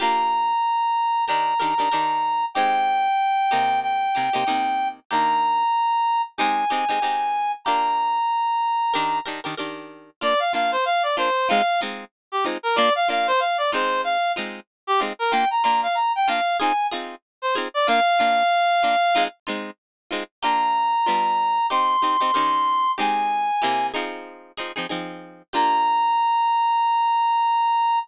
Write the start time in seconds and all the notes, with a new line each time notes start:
0.00 A#3 D4 F4 G4 A#5
1.27 D#3 D4 G4 A#4 A#5
1.60 D#3 D4 G4 A#4
1.78 D#3 D4 G4 A#4
1.91 D#3 D4 G4 A#4
2.54 G#3 C4 D#4 G4 G5
3.51 C3 A#3 D#4 G4
3.83 G5
4.15 C3 A#3 D#4 G4
4.33 C3 A#3 D#4 G4
4.47 C3 A#3 D#4 G4
5.11 D#3 A#3 D4 G4 A#5
6.38 G#3 C4 D#4 G4 G#5
6.70 G#3 C4 D#4 G4
6.89 G#3 C4 D#4 G4
7.02 G#3 C4 D#4 G4
7.65 A#3 D4 F4 G4 A#5
8.94 D#3 D4 G4 A#4
9.26 D#3 D4 G4 A#4
9.44 D#3 D4 G4 A#4
9.57 D#3 D4 G4 A#4
10.21 A#3 D4 F4 D5
10.39 F5
10.53 A#3 D4 F4 F5
10.72 C5
10.85 F5
11.03 D5
11.17 A#3 D4 F4 C5
11.49 G#3 C4 D#4 F4 F5
11.81 G#3 C4 D#4 F4
12.32 G4
12.45 G#3 C4 D#4 F4
12.63 A#4
12.76 A#3 D4 F4 D5
12.95 F5
13.09 A#3 D4 F4 F5
13.27 C5
13.40 F5
13.58 D5
13.72 G#3 C4 D#4 F4 C5
14.04 F5
14.36 G#3 C4 D#4 F4
14.87 G4
15.00 G#3 C4 D#4 F4
15.19 A#4
15.31 A#3 D4 F4 G5
15.51 A#5
15.63 A#3 D4 F4 A#5
15.83 F5
15.95 A#5
16.16 G5
16.28 A#3 D4 F4 F5
16.60 C4 D#4 F4 G#4 G#5
16.91 C4 D#4 F4 G#4
17.42 C5
17.55 C4 D#4 F4 G#4
17.74 D5
17.87 A#3 D4 F4 F5
18.19 A#3 D4 F4
18.83 A#3 D4 F4
19.15 G#3 C4 D#4 F4
19.47 G#3 C4 D#4 F4
20.11 G#3 C4 D#4 F4
20.42 A#3 D4 F4 G4 A#5
21.06 G3 B3 D4 F4
21.70 C4 D#4 G4 C6
22.02 C4 D#4 G4
22.21 C4 D#4 G4
22.34 D#3 C#4 G4 A#4
22.98 G#3 C4 D#4 G4 G#5
23.62 C3 A#3 E4 G4
23.94 F3 C4 D#4 G#4
24.57 F3 C4 D#4 G#4
24.76 F3 C4 D#4 G#4
24.89 F3 C4 D#4 G#4
25.53 A#3 D4 F4 G4 A#5